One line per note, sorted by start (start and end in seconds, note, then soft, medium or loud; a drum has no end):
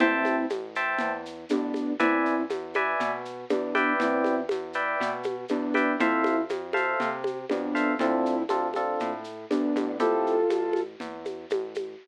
0.00 0.46 A1 loud
0.00 0.46 C4 medium
0.00 0.46 E4 medium
0.00 0.36 C5 medium
0.00 0.36 E5 medium
0.00 0.36 G5 medium
0.00 0.36 A5 loud
0.00 low conga loud
0.00 shaker medium
0.25 high conga medium
0.25 shaker medium
0.50 0.95 A1 medium
0.50 high conga medium
0.50 shaker medium
0.75 1.11 C5 medium
0.75 1.11 E5 medium
0.75 1.11 G5 medium
0.75 1.11 A5 medium
0.75 shaker medium
0.99 1.45 E2 medium
0.99 low conga medium
0.99 shaker medium
1.26 shaker medium
1.49 1.96 A1 medium
1.49 1.93 B3 medium
1.49 1.93 D4 medium
1.49 high conga medium
1.49 shaker medium
1.74 high conga medium
1.74 shaker medium
1.99 2.45 E2 medium
1.99 2.43 C4 medium
1.99 2.43 E4 medium
1.99 2.35 B4 loud
1.99 2.35 D5 loud
1.99 2.35 E5 loud
1.99 2.35 G#5 medium
1.99 low conga loud
1.99 shaker medium
2.26 shaker medium
2.50 2.95 E2 medium
2.50 high conga medium
2.50 shaker medium
2.74 3.11 B4 medium
2.74 3.11 D5 medium
2.74 3.11 E5 medium
2.74 3.11 G#5 medium
2.74 high conga medium
2.74 shaker medium
3.00 3.45 B2 medium
3.00 low conga medium
3.00 shaker medium
3.25 shaker medium
3.49 3.95 E2 medium
3.49 3.93 B3 medium
3.49 3.93 D4 medium
3.49 high conga medium
3.49 shaker medium
3.75 4.35 B4 loud
3.75 4.35 D5 loud
3.75 4.35 E5 medium
3.75 4.35 G5 loud
3.75 high conga medium
3.75 shaker medium
4.00 4.45 E2 loud
4.00 4.41 C4 medium
4.00 4.41 E4 medium
4.00 low conga loud
4.00 shaker medium
4.24 high conga medium
4.24 shaker medium
4.49 4.96 E2 medium
4.49 high conga medium
4.49 shaker medium
4.73 5.10 B4 medium
4.73 5.10 D5 medium
4.73 5.10 E5 medium
4.73 5.10 G5 medium
4.73 shaker medium
5.00 5.45 B2 medium
5.00 low conga medium
5.00 shaker medium
5.23 high conga medium
5.23 shaker medium
5.48 5.96 E2 medium
5.48 5.96 B3 medium
5.48 5.96 D4 medium
5.48 high conga medium
5.48 shaker medium
5.74 5.92 B4 medium
5.74 5.92 D5 medium
5.74 5.92 E5 medium
5.74 5.92 G5 medium
5.74 high conga medium
5.74 shaker medium
6.00 6.45 F2 loud
6.00 6.41 C4 medium
6.00 6.41 E4 medium
6.00 6.36 A4 loud
6.00 6.36 C5 loud
6.00 6.36 E5 loud
6.00 6.36 F5 medium
6.00 low conga loud
6.00 shaker medium
6.24 high conga medium
6.24 shaker medium
6.49 6.95 F2 medium
6.49 high conga medium
6.49 shaker medium
6.73 7.09 A4 medium
6.73 7.09 C5 medium
6.73 7.09 E5 medium
6.73 7.09 F5 medium
6.73 high conga medium
6.73 shaker medium
7.00 7.45 C3 medium
7.00 low conga medium
7.00 shaker medium
7.24 high conga medium
7.24 shaker medium
7.49 7.95 F2 medium
7.49 7.94 B3 medium
7.49 7.94 D4 medium
7.49 high conga medium
7.49 shaker medium
7.75 7.92 A4 medium
7.75 7.92 C5 medium
7.75 7.92 E5 medium
7.75 7.92 F5 medium
7.75 shaker medium
7.99 8.44 D2 loud
7.99 8.43 C4 medium
7.99 8.35 C4 loud
7.99 8.35 D4 loud
7.99 8.43 E4 medium
7.99 8.35 F4 medium
7.99 8.35 A4 medium
7.99 low conga medium
7.99 shaker medium
8.26 shaker medium
8.49 8.95 D2 medium
8.49 8.67 C4 medium
8.49 8.67 D4 medium
8.49 8.67 F4 medium
8.49 8.67 A4 medium
8.49 high conga medium
8.49 shaker medium
8.74 9.11 C4 medium
8.74 9.11 D4 medium
8.74 9.11 F4 medium
8.74 9.11 A4 loud
8.74 high conga medium
8.74 shaker medium
9.00 9.46 A2 medium
9.00 low conga medium
9.00 shaker medium
9.24 shaker medium
9.50 9.74 D2 medium
9.50 9.97 B3 medium
9.50 9.97 D4 medium
9.50 high conga medium
9.50 shaker medium
9.75 10.45 A1 loud
9.75 high conga medium
9.75 shaker medium
9.99 10.35 C4 medium
9.99 10.35 E4 medium
9.99 10.81 F4 medium
9.99 10.35 G4 loud
9.99 10.35 A4 medium
9.99 10.81 A4 medium
9.99 low conga medium
9.99 shaker medium
10.27 shaker medium
10.50 10.96 A1 medium
10.50 high conga medium
10.50 shaker medium
10.73 high conga medium
10.73 shaker medium
11.00 11.46 E2 medium
11.00 low conga medium
11.00 shaker medium
11.25 high conga medium
11.25 shaker medium
11.50 11.95 A1 medium
11.50 high conga loud
11.50 shaker medium
11.74 high conga medium
11.74 shaker medium